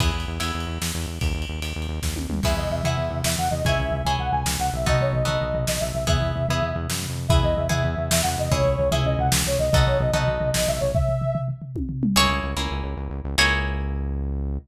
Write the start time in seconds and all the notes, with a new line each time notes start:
0.00 E2 B3 E4 G#4, kick, ride
0.14 E2
0.20 ride
0.28 E2
0.40 E2 B3 E4 G#4, ride
0.55 E2
0.60 ride
0.67 E2
0.81 E2, snare
0.95 E2
1.01 ride
1.07 E2
1.21 D#2, kick, ride
1.34 D#2
1.42 ride
1.49 D#2
1.62 D#2, ride
1.76 D#2
1.82 ride
1.88 D#2
2.02 D#2, kick, snare
2.15 D#2, high tom
2.29 D#2, mid tom
2.43 E2 B3 E4 G#4 E5, kick, crash
2.56 E2 D#5, floor tom
2.70 E2 E5, floor tom
2.84 E2 B3 E4 G#4 E5, floor tom
2.97 E2, floor tom
3.10 E2, floor tom
3.24 E2 E5, snare
3.37 E2 F#5, floor tom
3.51 E2 D#5, floor tom
3.64 C#2 C#4 E4 G#4 E5, kick, floor tom
3.79 C#2, floor tom
3.91 C#2, floor tom
4.04 C#2 C#4 E4 G#4 G#5, floor tom
4.19 C#2 F#5, floor tom
4.32 C#2 G#5, floor tom
4.45 C#2, snare
4.59 C#2 F#5, floor tom
4.73 B1 E5, floor tom
4.86 B3 D#4 F#4 A4 D#5, kick, floor tom
5.01 B1 C#5, floor tom
5.13 B1 D#5, floor tom
5.25 B1 B3 D#4 F#4 A4 D#5, floor tom
5.41 B1, floor tom
5.54 B1, floor tom
5.67 B1 D#5, snare
5.80 B1 E5, floor tom
5.94 B1 E5, floor tom
6.07 E2 B3 E4 G#4 E5, kick, floor tom
6.20 E2, floor tom
6.35 E2, floor tom
6.49 E2 B3 E4 G#4, floor tom
6.62 E2, floor tom
6.75 E2, floor tom
6.89 F#2, snare
7.03 floor tom
7.10 F2
7.16 floor tom
7.28 E2 B3 E4 G#4 E5, kick, floor tom
7.43 E2 D#5, floor tom
7.56 E2 E5, floor tom
7.69 E2 B3 E4 G#4 E5, floor tom
7.84 E2, floor tom
7.97 E2, floor tom
8.10 E2 E5, snare
8.23 E2 F#5, floor tom
8.38 E2 D#5, floor tom
8.51 C#2 C#4 E4 G#4 C#5, kick, floor tom
8.64 C#2, floor tom
8.78 C#2, floor tom
8.91 C#2 C#4 E4 G#4 E5, floor tom
9.05 C#2 D#5, floor tom
9.18 C#2 F#5, floor tom
9.32 C#2, snare
9.45 C#2 C#5, floor tom
9.59 C#2 D#5, floor tom
9.72 B1 B3 D#4 F#4 A4 D#5, kick, floor tom
9.86 B1 C#5, floor tom
10.00 B1 D#5, floor tom
10.13 B1 B3 D#4 F#4 A4 D#5, floor tom
10.27 B1, floor tom
10.40 B1, floor tom
10.54 B1 D#5, snare
10.67 B1 E5, floor tom
10.80 B1 C#5, floor tom
10.94 E5, kick, floor tom
11.09 floor tom
11.21 floor tom
11.35 floor tom
11.48 floor tom
11.62 floor tom
11.76 kick, high tom
11.89 floor tom
12.03 mid tom
12.16 C#2 A#3 C#4 E4 G#4 C#5
12.29 C#2
12.43 C#2
12.57 C#2 A#3 C#4 E4 G#4
12.71 C#2
12.84 C#2
12.97 C#2
13.10 C#2
13.24 C#2
13.38 C#2 A#3 C#4 E4 G#4 C#5